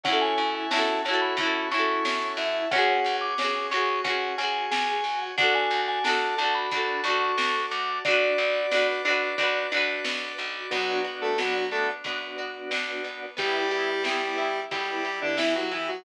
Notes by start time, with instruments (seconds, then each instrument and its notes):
0.04 electric bass (finger) F#2, drawbar organ C#4 C#5 E5 F#5 A5, acoustic guitar (steel) C#4, vibraphone F#5, kick, closed hi-hat
0.08 acoustic guitar (steel) E4 F#4
0.13 acoustic guitar (steel) A4
0.22 vibraphone G#5
0.38 electric bass (finger) F#2, drawbar organ E4, closed hi-hat
0.55 vibraphone G#5
0.71 electric bass (finger) F#2, acoustic guitar (steel) C#4 E4, drawbar organ F#4, vibraphone A5, snare
0.76 acoustic guitar (steel) F#4 A4
1.04 electric bass (finger) F#2, acoustic guitar (steel) C#4, drawbar organ A4, vibraphone A5, closed hi-hat
1.08 acoustic guitar (steel) E4 F#4
1.13 acoustic guitar (steel) A4
1.22 vibraphone B5
1.37 electric bass (finger) F#2, acoustic guitar (steel) C#4 E4, drawbar organ F#4, kick, closed hi-hat
1.43 acoustic guitar (steel) F#4 A4
1.70 electric bass (finger) F#2, acoustic guitar (steel) C#4 E4, drawbar organ E4, vibraphone C#6, closed hi-hat
1.77 acoustic guitar (steel) F#4 A4
2.05 electric bass (finger) F#2, drawbar organ C#4, snare
2.37 electric bass (finger) F#2, drawbar organ E4, vibraphone E5, open hi-hat
2.71 electric bass (finger) C#2, drawbar organ C#4 C#5 F#5 G#5, acoustic guitar (steel) C#4, vibraphone F#5, kick, closed hi-hat
2.75 acoustic guitar (steel) F#4 G#4
3.05 electric bass (finger) C#2, drawbar organ F#4, closed hi-hat
3.21 vibraphone D6
3.38 electric bass (finger) C#2, acoustic guitar (steel) C#4 F#4, drawbar organ G#4, snare
3.44 acoustic guitar (steel) G#4
3.71 electric bass (finger) C#2, acoustic guitar (steel) C#4 F#4, drawbar organ F#4, vibraphone C#6, closed hi-hat
3.77 acoustic guitar (steel) G#4
4.04 electric bass (finger) C#2, drawbar organ C#4, acoustic guitar (steel) C#4 F#4, vibraphone F#5, kick, closed hi-hat
4.10 acoustic guitar (steel) G#4
4.38 electric bass (finger) C#2, acoustic guitar (steel) C#4 F#4, drawbar organ F#4, vibraphone G#5, closed hi-hat
4.43 acoustic guitar (steel) G#4
4.71 electric bass (finger) C#2, drawbar organ G#4, vibraphone G#5, snare
5.04 electric bass (finger) C#2, drawbar organ F#4, open hi-hat
5.36 electric bass (finger) D2, drawbar organ D4 D5 F#5 A5, acoustic guitar (steel) D4, vibraphone F#5, kick, closed hi-hat
5.40 acoustic guitar (steel) F#4 A4
5.55 vibraphone G#5
5.71 electric bass (finger) D2, drawbar organ F#4, closed hi-hat
5.88 vibraphone G#5
6.04 electric bass (finger) D2, acoustic guitar (steel) D4 F#4, drawbar organ A4, vibraphone A5, snare
6.09 acoustic guitar (steel) A4
6.37 electric bass (finger) D2, acoustic guitar (steel) D4, drawbar organ F#4, vibraphone A5, closed hi-hat
6.41 acoustic guitar (steel) F#4 A4
6.55 vibraphone B5
6.72 electric bass (finger) D2, acoustic guitar (steel) D4 F#4, drawbar organ D4, kick, closed hi-hat
6.77 acoustic guitar (steel) A4
7.04 electric bass (finger) D2, acoustic guitar (steel) D4, drawbar organ F#4, vibraphone C#6, closed hi-hat
7.08 acoustic guitar (steel) F#4 A4
7.38 electric bass (finger) D2, drawbar organ A4, snare
7.71 electric bass (finger) D2, drawbar organ F#4, vibraphone D6, closed hi-hat
8.05 electric bass (finger) B1, acoustic guitar (steel) D4 F#4, drawbar organ D4 D5 F#5 B5, vibraphone D5, kick, closed hi-hat
8.11 acoustic guitar (steel) B4
8.38 electric bass (finger) B1, drawbar organ F#4, closed hi-hat
8.71 electric bass (finger) B1, acoustic guitar (steel) D4 F#4, drawbar organ B4, snare
8.77 acoustic guitar (steel) B4
9.05 electric bass (finger) B1, acoustic guitar (steel) D4 F#4, drawbar organ F#4, closed hi-hat
9.10 acoustic guitar (steel) B4
9.38 electric bass (finger) B1, acoustic guitar (steel) D4 F#4, drawbar organ D4, kick, closed hi-hat
9.43 acoustic guitar (steel) B4
9.72 electric bass (finger) B1, acoustic guitar (steel) D4 F#4, drawbar organ F#4, closed hi-hat
9.77 acoustic guitar (steel) B4
10.04 electric bass (finger) B1, drawbar organ B4, snare
10.38 electric bass (finger) B1, drawbar organ F#4, closed hi-hat
10.71 electric bass (finger) B1, lead 1 (square) F#3 F#4, drawbar organ B3 D4 F#4, acoustic guitar (steel) B3, kick, crash
11.04 acoustic guitar (steel) F#4, ride
11.22 lead 1 (square) A3 A4
11.38 electric bass (finger) B1, lead 1 (square) F#3 F#4, acoustic guitar (steel) B3, snare
11.72 lead 1 (square) A3 A4, acoustic guitar (steel) D4, ride
12.04 electric bass (finger) F#2, acoustic guitar (steel) B3, drawbar organ B3 D4 F#4, kick, ride
12.38 acoustic guitar (steel) F#4, ride
12.71 electric bass (finger) B1, acoustic guitar (steel) D4, snare
13.04 acoustic guitar (steel) B3, ride
13.37 electric bass (finger) G1, lead 1 (square) G3 G4, acoustic guitar (steel) B3, drawbar organ B3 E4 G4, kick, ride
13.71 acoustic guitar (steel) G4, ride
14.04 electric bass (finger) G1, lead 1 (square) G3 G4, acoustic guitar (steel) B3, snare
14.38 acoustic guitar (steel) E4, ride
14.71 electric bass (finger) B1, lead 1 (square) G3 G4, drawbar organ B3 E4 G4, acoustic guitar (steel) B3, kick, ride
15.05 acoustic guitar (steel) G4, ride
15.21 lead 1 (square) D3 D4
15.37 electric bass (finger) G1, lead 1 (square) E3 E4, acoustic guitar (steel) E4, snare
15.55 lead 1 (square) F#3 F#4
15.71 lead 1 (square) E3 E4, acoustic guitar (steel) B3, ride
15.88 lead 1 (square) F#3 F#4